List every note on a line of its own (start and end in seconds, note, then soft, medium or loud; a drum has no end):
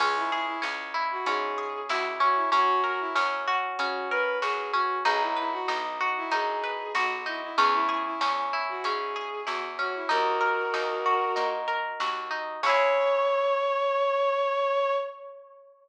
0.00 0.57 C#2 loud
0.00 0.61 C#4 loud
0.00 0.15 G#4 medium
0.00 kick loud
0.00 crash loud
0.16 0.30 E4 medium
0.31 0.46 E4 medium
0.31 1.57 G#4 medium
0.46 0.61 E4 medium
0.62 1.20 C#2 medium
0.62 1.26 C#4 medium
0.62 snare loud
0.94 1.90 E4 medium
1.11 1.26 F#4 medium
1.26 1.83 G#2 loud
1.26 2.20 C#4 medium
1.26 1.80 G#4 medium
1.26 closed hi-hat loud
1.58 2.48 G#4 medium
1.89 2.46 C#2 medium
1.89 2.50 E4 medium
1.89 2.04 F#4 medium
1.89 snare loud
2.20 2.50 C#4 medium
2.20 2.35 F#4 medium
2.35 2.50 E4 medium
2.52 3.09 F#2 loud
2.52 3.15 C#4 loud
2.52 2.81 F#4 medium
2.52 kick loud
2.52 closed hi-hat loud
2.84 2.99 F#4 medium
2.84 4.11 A#4 medium
3.00 3.15 E4 medium
3.15 3.73 F#2 loud
3.15 3.79 C#4 medium
3.15 snare loud
3.48 4.42 F#4 loud
3.78 4.36 C#3 loud
3.78 4.73 C#4 loud
3.78 4.08 F#4 medium
3.78 closed hi-hat loud
4.10 5.01 A#4 medium
4.10 4.38 B4 medium
4.41 4.99 F#2 medium
4.41 5.02 F#4 medium
4.41 4.71 G#4 medium
4.41 snare loud
4.72 5.03 C#4 medium
4.72 4.98 F#4 medium
5.05 5.62 B1 loud
5.05 5.68 D#4 loud
5.05 5.20 G#4 medium
5.05 kick loud
5.05 closed hi-hat loud
5.21 5.36 E4 medium
5.36 5.52 E4 medium
5.36 6.63 B4 medium
5.52 5.67 F#4 medium
5.68 6.25 B1 medium
5.68 6.31 D#4 loud
5.68 snare loud
6.01 6.94 F#4 loud
6.17 6.32 E4 medium
6.31 6.88 F#2 loud
6.31 7.26 D#4 medium
6.31 6.92 G#4 medium
6.31 closed hi-hat loud
6.64 7.54 B4 medium
6.95 7.52 B1 medium
6.95 7.55 F#4 loud
6.95 7.10 F#4 medium
6.95 snare loud
7.26 7.56 D#4 medium
7.26 7.41 E4 medium
7.43 7.58 E4 medium
7.57 8.15 E2 loud
7.57 8.20 C#4 loud
7.57 7.72 G#4 medium
7.57 kick loud
7.57 closed hi-hat loud
7.74 7.88 E4 medium
7.89 8.04 E4 medium
7.89 9.15 G#4 medium
8.05 8.20 E4 medium
8.21 8.78 E2 loud
8.21 8.84 C#4 medium
8.21 snare loud
8.53 9.46 E4 medium
8.69 8.84 F#4 medium
8.84 9.41 G#2 medium
8.84 9.78 C#4 medium
8.84 9.41 G#4 medium
8.84 closed hi-hat loud
9.16 10.06 G#4 medium
9.46 10.04 E2 medium
9.46 10.07 E4 medium
9.46 9.61 F#4 medium
9.46 snare loud
9.79 10.09 C#4 medium
9.79 9.94 F#4 medium
9.95 10.10 E4 medium
10.09 10.67 D#2 loud
10.09 10.73 D#4 loud
10.09 11.48 F#4 medium
10.09 11.48 A#4 medium
10.09 kick loud
10.09 closed hi-hat loud
10.41 11.67 A#4 medium
10.74 11.31 D#2 medium
10.74 11.35 D#4 medium
10.74 snare loud
11.06 12.00 F#4 medium
11.36 11.94 A#2 medium
11.36 12.30 D#4 medium
11.36 closed hi-hat loud
11.68 12.58 A#4 medium
12.00 12.57 D#2 medium
12.00 12.60 F#4 medium
12.00 snare loud
12.31 12.61 D#4 medium
12.63 14.93 C#2 loud
12.63 14.93 C#4 loud
12.63 14.93 E4 loud
12.63 14.94 C#5 loud
12.63 kick loud
12.63 crash loud
12.69 14.93 G#4 loud